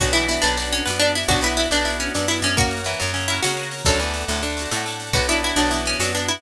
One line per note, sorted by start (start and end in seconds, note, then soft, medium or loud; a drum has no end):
0.00 0.38 B1 medium
0.00 0.13 F#3 medium
0.00 0.13 B3 loud
0.00 1.27 B3 medium
0.00 1.27 D4 medium
0.00 0.13 D4 loud
0.00 1.27 F#4 medium
0.00 0.13 F#4 medium
0.00 0.12 F#4 loud
0.00 kick loud
0.00 snare medium
0.04 0.13 F#4 loud
0.04 snare medium
0.13 0.41 E3 medium
0.13 0.27 B3 loud
0.13 0.27 D4 medium
0.13 0.27 E4 loud
0.13 0.41 E4 medium
0.13 snare medium
0.19 0.27 F#4 medium
0.19 snare medium
0.28 0.41 B3 loud
0.28 0.41 D4 medium
0.28 0.43 E4 loud
0.28 snare medium
0.33 0.41 F#4 loud
0.33 snare medium
0.42 0.82 B1 medium
0.42 0.56 B3 medium
0.42 0.69 D4 loud
0.42 0.56 D4 medium
0.42 0.56 B4 medium
0.42 snare medium
0.48 0.56 F#4 medium
0.48 snare medium
0.57 0.84 B3 medium
0.57 0.84 D4 medium
0.57 0.84 D5 medium
0.57 snare medium
0.62 0.84 F#4 loud
0.62 snare medium
0.72 0.84 C#4 loud
0.72 snare medium
0.77 snare medium
0.85 1.25 F#2 medium
0.85 0.99 B3 loud
0.85 0.99 B3 medium
0.85 0.99 D4 loud
0.85 0.99 B4 medium
0.85 snare loud
0.90 0.99 F#4 medium
0.90 snare medium
0.99 1.26 B3 loud
0.99 1.12 D4 loud
0.99 1.26 D4 loud
0.99 snare medium
1.05 1.26 F#4 medium
1.05 snare medium
1.15 1.28 E4 loud
1.15 snare medium
1.23 snare medium
1.28 1.67 B1 medium
1.28 1.42 B3 loud
1.28 2.56 B3 medium
1.28 1.40 D4 medium
1.28 2.56 D4 medium
1.28 1.42 D4 loud
1.28 1.41 F#4 loud
1.28 2.56 F#4 medium
1.28 1.40 D5 medium
1.28 kick loud
1.28 snare medium
1.33 1.42 F#4 loud
1.33 snare medium
1.41 1.66 B3 medium
1.41 1.56 B3 medium
1.41 1.56 E4 loud
1.41 1.66 B4 medium
1.41 snare medium
1.46 1.56 D4 loud
1.46 1.56 F#4 medium
1.50 snare medium
1.57 1.70 B3 medium
1.57 1.70 D4 medium
1.57 1.69 E4 loud
1.57 snare medium
1.61 1.70 F#4 medium
1.61 snare medium
1.71 2.09 B1 medium
1.71 1.85 B3 medium
1.71 1.85 D4 medium
1.71 1.97 D4 loud
1.71 1.85 D4 medium
1.71 1.85 D5 medium
1.71 snare medium
1.76 1.85 F#4 medium
1.76 snare medium
1.85 2.12 B3 loud
1.85 2.12 D4 medium
1.85 2.12 E4 medium
1.85 2.12 E5 medium
1.85 snare medium
1.90 2.12 F#4 loud
1.90 snare medium
1.99 2.13 C#4 medium
1.99 snare medium
2.06 snare medium
2.14 2.42 F#2 medium
2.14 2.27 B3 medium
2.14 2.28 D4 medium
2.14 2.27 D4 medium
2.14 2.28 D5 medium
2.14 snare loud
2.19 2.27 F#4 medium
2.19 snare medium
2.28 2.55 B3 medium
2.28 2.55 D4 medium
2.28 2.40 E4 loud
2.28 snare medium
2.34 2.55 F#4 medium
2.34 snare medium
2.42 2.95 F#2 medium
2.42 2.55 C#4 loud
2.42 snare medium
2.51 snare medium
2.57 2.81 A#3 medium
2.57 3.23 A#3 loud
2.57 3.23 C#4 loud
2.57 3.15 F#4 loud
2.57 2.81 A#4 medium
2.57 3.85 A#4 medium
2.57 3.85 C#5 medium
2.57 3.85 F#5 medium
2.57 kick loud
2.57 snare medium
2.62 3.23 F#4 loud
2.62 snare medium
2.71 snare medium
2.77 snare medium
2.84 2.99 E3 medium
2.84 2.99 E4 medium
2.84 snare medium
2.93 snare medium
3.00 3.12 F#2 medium
3.00 3.40 F#2 medium
3.00 3.12 F#3 medium
3.00 snare medium
3.07 snare medium
3.14 3.51 C#3 medium
3.14 3.51 C#4 medium
3.14 snare medium
3.21 snare medium
3.28 3.42 A#3 loud
3.28 3.42 C#4 loud
3.28 3.40 E4 loud
3.28 snare medium
3.33 3.42 F#4 loud
3.33 snare medium
3.43 3.83 C#3 medium
3.43 3.56 A#3 medium
3.43 3.56 C#4 medium
3.43 3.82 F#4 loud
3.43 snare loud
3.48 3.56 F#4 loud
3.48 snare medium
3.57 3.83 A#3 medium
3.57 3.83 C#4 medium
3.57 snare medium
3.62 3.83 F#4 medium
3.62 snare medium
3.71 snare medium
3.78 snare medium
3.85 4.24 D2 medium
3.85 3.99 F#2 medium
3.85 3.99 F#3 medium
3.85 4.51 A3 loud
3.85 4.51 D4 loud
3.85 5.13 A4 medium
3.85 4.46 A4 loud
3.85 5.13 D5 medium
3.85 5.13 F#5 medium
3.85 kick loud
3.85 snare medium
3.90 4.51 F#4 loud
3.90 snare medium
3.99 4.25 E2 medium
3.99 4.25 E3 medium
3.99 snare medium
4.08 snare medium
4.14 snare medium
4.20 snare medium
4.28 4.67 D2 medium
4.28 4.42 A2 medium
4.28 4.42 A3 medium
4.28 snare medium
4.36 snare medium
4.42 4.69 D3 medium
4.42 4.69 D4 medium
4.42 snare medium
4.50 snare medium
4.57 4.70 A3 medium
4.57 4.70 D4 medium
4.57 snare medium
4.62 4.70 F#4 loud
4.62 snare medium
4.71 4.85 A2 medium
4.71 5.11 A2 medium
4.71 4.85 A3 medium
4.71 4.85 D4 medium
4.71 snare loud
4.76 4.85 F#4 loud
4.76 snare medium
4.86 5.12 A3 medium
4.86 5.12 D4 medium
4.86 snare medium
4.90 5.12 F#4 medium
4.90 snare medium
5.00 snare medium
5.07 snare medium
5.13 5.52 B1 medium
5.13 5.27 B3 loud
5.13 6.41 B3 medium
5.13 5.27 B3 medium
5.13 6.41 D4 medium
5.13 5.27 D4 loud
5.13 5.27 F#4 loud
5.13 6.41 F#4 medium
5.13 5.27 B4 medium
5.13 kick loud
5.13 snare medium
5.19 5.27 F#4 loud
5.19 snare medium
5.28 5.68 B3 loud
5.28 5.55 D4 medium
5.28 5.68 D4 loud
5.28 5.41 E4 loud
5.28 5.55 D5 medium
5.28 snare medium
5.33 5.68 F#4 medium
5.33 snare medium
5.43 5.58 E4 loud
5.43 snare medium
5.49 snare medium
5.56 5.95 B1 medium
5.56 5.71 F#3 medium
5.56 5.80 D4 loud
5.56 5.71 F#4 medium
5.56 snare medium
5.65 snare medium
5.71 5.97 E3 medium
5.71 5.98 B3 loud
5.71 5.98 D4 medium
5.71 5.97 E4 medium
5.71 snare medium
5.76 5.98 F#4 medium
5.76 snare medium
5.86 5.99 C#4 loud
5.86 snare medium
5.93 snare medium
6.00 6.38 F#2 medium
6.00 6.12 F#3 medium
6.00 6.13 B3 medium
6.00 6.13 D4 medium
6.00 6.12 F#4 medium
6.00 snare loud
6.05 6.13 F#4 loud
6.05 snare medium
6.13 6.41 B3 medium
6.13 6.26 D4 loud
6.13 snare medium
6.17 6.41 D4 medium
6.17 6.41 F#4 medium
6.17 snare medium
6.28 6.41 E4 loud
6.28 snare medium
6.37 snare medium